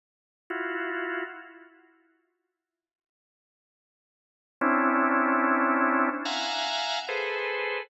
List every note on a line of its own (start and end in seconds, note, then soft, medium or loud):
0.50 1.24 E4 medium
0.50 1.24 F4 medium
0.50 1.24 F#4 medium
4.61 6.09 C4 loud
4.61 6.09 C#4 loud
4.61 6.09 D4 loud
4.61 6.09 E4 loud
6.25 6.99 E5 medium
6.25 6.99 F5 medium
6.25 6.99 F#5 medium
6.25 6.99 G#5 medium
6.25 6.99 A#5 medium
7.08 7.82 G#4 medium
7.08 7.82 A4 medium
7.08 7.82 B4 medium
7.08 7.82 C5 medium